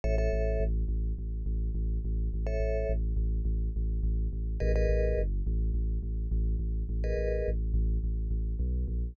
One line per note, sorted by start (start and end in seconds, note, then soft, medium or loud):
0.04 0.28 A1 loud
0.04 0.15 A4 medium
0.04 0.15 C#5 loud
0.04 0.15 E5 loud
0.18 0.64 A4 medium
0.18 0.64 C#5 medium
0.18 0.64 E5 medium
0.33 0.57 A1 loud
0.60 0.84 A1 loud
0.88 1.13 A1 loud
1.18 1.43 A1 medium
1.46 1.70 A1 loud
1.74 1.99 A1 loud
2.04 2.29 A1 loud
2.34 2.58 A1 medium
2.47 2.92 A4 medium
2.47 2.92 C#5 medium
2.47 2.92 E5 medium
2.60 2.84 A1 medium
2.89 3.13 A1 loud
3.16 3.41 A1 loud
3.45 3.69 A1 loud
3.76 4.00 A1 loud
4.03 4.28 A1 loud
4.33 4.57 A1 medium
4.60 4.86 A1 loud
4.60 4.72 G#4 medium
4.60 4.72 A#4 loud
4.60 4.72 B4 medium
4.60 4.72 D#5 medium
4.76 5.21 G#4 medium
4.76 5.21 A#4 medium
4.76 5.21 B4 medium
4.76 5.21 D#5 medium
4.89 5.13 A1 loud
5.17 5.42 G1 loud
5.47 5.71 A1 loud
5.74 5.98 A1 loud
6.03 6.27 A1 medium
6.31 6.56 A1 loud
6.59 6.83 A1 loud
6.89 7.13 A1 loud
7.04 7.49 G#4 medium
7.04 7.49 A#4 medium
7.04 7.49 B4 medium
7.04 7.49 D#5 medium
7.17 7.42 A1 medium
7.48 7.72 A1 loud
7.74 7.98 A1 loud
8.04 8.28 A1 medium
8.30 8.55 A1 medium
8.59 8.85 B1 loud
8.88 9.13 A#1 loud